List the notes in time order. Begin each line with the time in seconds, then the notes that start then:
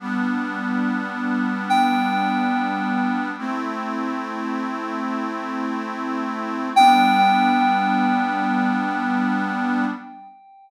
0.00 G3 B3 D4
1.70 G5
3.38 A3 C4 E4
6.76 G3 B3 D4 G5